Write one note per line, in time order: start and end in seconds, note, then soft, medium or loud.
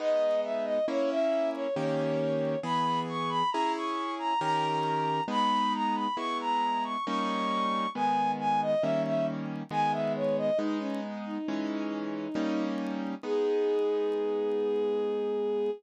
0.00 0.79 G#3 loud
0.00 0.79 B3 loud
0.00 0.79 D#4 loud
0.00 0.40 D#5 medium
0.44 0.65 E5 medium
0.65 0.86 D#5 medium
0.88 1.67 A#3 loud
0.88 1.67 C#4 loud
0.88 1.67 E4 loud
0.88 1.10 C#5 medium
1.10 1.50 E5 medium
1.54 1.75 C#5 medium
1.76 2.56 D#3 loud
1.76 2.56 A#3 loud
1.76 2.56 C#4 loud
1.76 2.56 G4 loud
1.76 2.59 C#5 medium
2.63 3.43 E3 loud
2.63 3.43 B3 loud
2.63 3.43 G#4 loud
2.63 3.00 B5 medium
3.09 3.30 C#6 medium
3.29 3.50 B5 medium
3.51 4.34 C#4 loud
3.51 4.34 E4 loud
3.51 4.34 G#4 loud
3.51 3.72 A#5 medium
3.76 4.14 C#6 medium
4.19 4.40 A#5 medium
4.41 5.20 D#3 loud
4.41 5.20 C#4 loud
4.41 5.20 G4 loud
4.41 5.20 A#4 loud
4.41 5.23 A#5 medium
5.28 6.07 G#3 loud
5.28 6.07 B3 loud
5.28 6.07 D#4 loud
5.28 5.73 B5 medium
5.74 5.95 A#5 medium
5.95 6.16 B5 medium
6.17 6.96 G#3 loud
6.17 6.96 B3 medium
6.17 6.96 E4 loud
6.17 6.38 C#6 medium
6.41 6.84 A#5 medium
6.84 7.05 C#6 medium
7.06 7.86 G3 loud
7.06 7.86 A#3 loud
7.06 7.86 C#4 loud
7.06 7.86 D#4 loud
7.06 7.89 C#6 medium
7.95 8.75 D#3 loud
7.95 8.75 G#3 medium
7.95 8.75 B3 loud
7.95 8.31 G#5 medium
8.40 8.60 G#5 medium
8.62 8.83 D#5 medium
8.81 9.63 D#3 loud
8.81 9.63 G3 medium
8.81 9.63 A#3 medium
8.81 9.63 C#4 loud
8.81 9.02 E5 medium
9.05 9.26 E5 medium
9.71 10.50 D#3 loud
9.71 10.50 G#3 loud
9.71 10.50 B3 loud
9.71 9.92 G#5 medium
9.92 10.13 E5 medium
10.16 10.37 C#5 medium
10.37 10.58 D#5 medium
10.57 11.38 G#3 loud
10.57 11.38 B3 loud
10.57 10.78 D#4 medium
10.57 11.38 D#4 loud
10.79 11.00 C#4 medium
11.26 12.65 D#4 medium
11.48 12.28 E3 loud
11.48 12.28 G#3 loud
11.48 12.28 C#4 loud
12.35 13.15 G3 loud
12.35 13.15 A#3 loud
12.35 13.15 C#4 loud
12.35 13.15 D#4 loud
13.23 15.70 G#3 medium
13.23 15.70 B3 loud
13.23 15.70 D#4 loud
13.23 15.71 G#4 loud